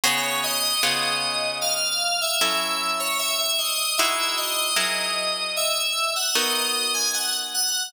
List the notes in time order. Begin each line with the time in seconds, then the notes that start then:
0.04 C#3 B3 F#4 G#4 C#5
0.43 D#5
0.83 C#3 B3 F4 G#4
1.61 F5
2.21 E5
2.41 F#3 C#4 E4 A4 E5
3.00 C#5
3.19 E5
3.38 E5
3.58 D#5
3.98 G#3 D#4 E4 F#4 E5
4.37 D#5
4.76 F#3 E4 G#4 A#4
5.56 E5
6.16 F#5
6.34 B3 D#4 F#4 A#4 D#5
6.94 G#5
7.14 F#5
7.54 F#5